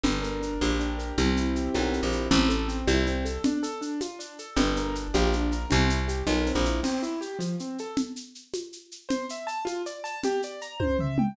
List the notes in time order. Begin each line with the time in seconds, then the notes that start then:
0.03 G1 D4, low conga, shaker
0.22 A#4, shaker
0.41 D4, shaker
0.61 A#1 G4, high conga, shaker
0.79 D4, shaker
0.98 A#4, shaker
1.18 C2 C4, low conga, shaker
1.37 E4, shaker
1.55 G4, shaker
1.74 B1 A#4, high conga, shaker
1.92 C4, shaker
2.03 A#1
2.12 E4, shaker
2.31 A1 C4, low conga, shaker
2.49 A4, shaker
2.68 C4, shaker
2.87 C2 E4, high conga, shaker
3.07 C4, shaker
3.25 A4, shaker
3.44 D4, low conga, shaker
3.63 A4, shaker
3.81 D4, shaker
4.01 F4, high conga, shaker
4.19 D4, shaker
4.39 A4, shaker
4.56 G1 D4, low conga, shaker
4.76 A#4, shaker
4.95 D4, shaker
5.14 A#1 G4, high conga, shaker
5.33 D4, shaker
5.52 A#4, shaker
5.70 C2 C4, low conga, shaker
5.89 E4, shaker
6.08 G4, shaker
6.27 B1 A#4, high conga, shaker
6.46 C4, shaker
6.55 A#1
6.65 E4, shaker
6.83 C4, crash, low conga, shaker
7.03 E4, shaker
7.21 G4, shaker
7.39 F3, high conga, shaker
7.59 C4, shaker
7.78 A4, shaker
7.97 low conga, shaker
8.16 shaker
8.35 shaker
8.54 high conga, shaker
8.72 shaker
8.91 shaker
9.09 C5, low conga, shaker
9.29 E5, shaker
9.47 A5, shaker
9.65 F4, high conga, shaker
9.86 D5, shaker
10.04 A5, shaker
10.24 G4, low conga, shaker
10.42 D5, shaker
10.61 A#5, shaker
10.80 C5, kick, high tom
10.99 E5, floor tom
11.18 G5, mid tom